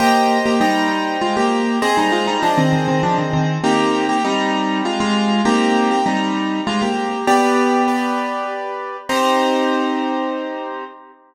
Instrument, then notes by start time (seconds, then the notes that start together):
acoustic grand piano
0.00 A#3 G4 C5 D#5 G5
0.46 A#3 G4
0.60 G3 D#4 C5 D#5 G5
1.21 G#3 F4
1.37 A#3 G4
1.82 C4 G#4 C5 D#5
1.97 G3 D#4
2.12 G#3 F4
2.27 G3 D#4
2.43 F3 D4 G#4 C5 D#5
2.57 D#3 C4
2.73 D#3 C4
2.88 D#3 C4
3.03 F3 D4
3.18 D#3 C4
3.33 D#3 C4
3.64 A#3 C4 D#4 G4
4.09 A#3 G4
4.24 G3 C4 D#4 G4
4.85 G#3 F4
5.00 G#3 F4
5.45 A#3 C4 D#4 G4
5.91 A#3 G4
6.06 G3 C4 D#4 G4
6.67 G#3 F4
6.82 A#3 G4
7.27 B3 G4 B4 D5
7.88 G4 B4 D5
9.09 C4 D#4 G4 C5